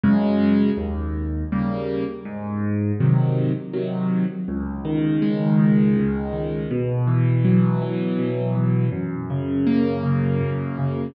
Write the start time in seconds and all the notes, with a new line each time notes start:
0.04 F#2 C#3 G#3
0.77 D#2
1.52 C#3 G3 A#3
2.25 G#2
3.00 C3 D#3 F#3
3.73 C3 D#3 F#3
4.48 C#2
4.85 D#3
5.22 G#3
5.59 D#3
5.97 C#2
6.33 D#3
6.71 B2
7.07 E3
7.45 F#3
7.82 E3
8.19 B2
8.55 E3
8.92 F#2
9.30 C#3
9.67 A#3
10.03 C#3
10.41 F#2
10.78 C#3